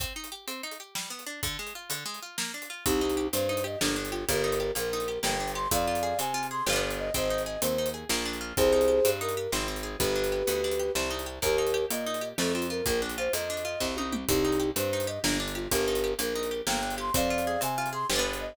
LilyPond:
<<
  \new Staff \with { instrumentName = "Flute" } { \time 9/8 \key c \minor \tempo 4. = 126 r1 r8 | r1 r8 | <ees' g'>4. c''4 ees''8 d'8 r8 f'8 | <g' bes'>4. bes'4. g''4 c'''8 |
<d'' f''>4. aes''4 c'''8 b'8 r8 ees''8 | <c'' ees''>4 ees''8 c''4 r2 | <aes' c''>2 bes'4 r4. | <g' b'>2.~ <g' b'>8 r4 |
<g' bes'>4. ees''4. a'8 f'8 bes'8 | bes'8 r8 c''8 ees''2 r4 | <ees' g'>4. c''4 ees''8 d'8 r8 f'8 | <g' bes'>4. bes'4. g''4 c'''8 |
<d'' f''>4. aes''4 c'''8 b'8 r8 ees''8 | }
  \new Staff \with { instrumentName = "Orchestral Harp" } { \time 9/8 \key c \minor c'8 ees'8 g'8 c'8 ees'8 g'8 g8 b8 d'8 | d8 aes8 f'8 d8 aes8 f'8 bes8 d'8 f'8 | c'8 ees'8 g'8 c'8 ees'8 g'8 bes8 d'8 g'8 | bes8 ees'8 g'8 bes8 ees'8 g'8 bes8 d'8 g'8 |
c'8 f'8 aes'8 c'8 f'8 aes'8 <b d' f' g'>4. | c'8 ees'8 aes'8 c'8 ees'8 aes'8 bes8 d'8 f'8 | c'8 ees'8 g'8 c'8 ees'8 g'8 c'8 ees'8 aes'8 | b8 d'8 g'8 b8 d'8 g'8 c'8 ees'8 g'8 |
bes8 ees'8 g'8 bes8 ees'8 g'8 a8 c'8 f'8 | bes8 d'8 f'8 bes8 d'8 f'8 c'8 ees'8 g'8 | c'8 ees'8 g'8 c'8 ees'8 g'8 bes8 d'8 g'8 | bes8 ees'8 g'8 bes8 ees'8 g'8 bes8 d'8 g'8 |
c'8 f'8 aes'8 c'8 f'8 aes'8 <b d' f' g'>4. | }
  \new Staff \with { instrumentName = "Electric Bass (finger)" } { \clef bass \time 9/8 \key c \minor r1 r8 | r1 r8 | c,4. g,4. g,,4. | g,,4. bes,,4. g,,4. |
f,4. c4. g,,4. | aes,,4. ees,4. bes,,4. | c,4. g,4. aes,,4. | g,,4. d,4. c,4. |
ees,4. bes,4. f,4. | bes,,4. f,4. c,4. | c,4. g,4. g,,4. | g,,4. bes,,4. g,,4. |
f,4. c4. g,,4. | }
  \new DrumStaff \with { instrumentName = "Drums" } \drummode { \time 9/8 <hh bd>8. hh8. hh8. hh8. sn8. hh8. | <hh bd>8. hh8. hh8. hh8. sn8. hh8. | <hh bd>8. hh8. hh8. hh8. sn8. hh8. | <hh bd>8. hh8. hh8. hh8. sn8. hh8. |
<hh bd>8. hh8. hh8. hh8. sn8. hh8. | <hh bd>8. hh8. hh8. hh8. sn8. hh8. | <hh bd>8. hh8. hh8. hh8. sn8. hh8. | <hh bd>8. hh8. hh8. hh8. sn8. hh8. |
<hh bd>8. hh8. hh8. hh8. sn8. hh8. | <hh bd>8. hh8. hh8. hh8. <bd sn>8 tommh8 toml8 | <hh bd>8. hh8. hh8. hh8. sn8. hh8. | <hh bd>8. hh8. hh8. hh8. sn8. hh8. |
<hh bd>8. hh8. hh8. hh8. sn8. hh8. | }
>>